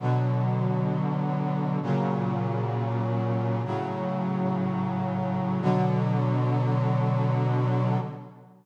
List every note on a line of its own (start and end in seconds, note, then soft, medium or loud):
0.00 1.79 B2 medium
0.00 1.79 D3 medium
0.00 1.79 F#3 medium
1.82 3.62 A#2 loud
1.82 3.62 C#3 medium
1.82 3.62 F#3 medium
3.65 5.61 A2 medium
3.65 5.61 C#3 medium
3.65 5.61 F#3 medium
5.62 7.98 B2 loud
5.62 7.98 D3 loud
5.62 7.98 F#3 loud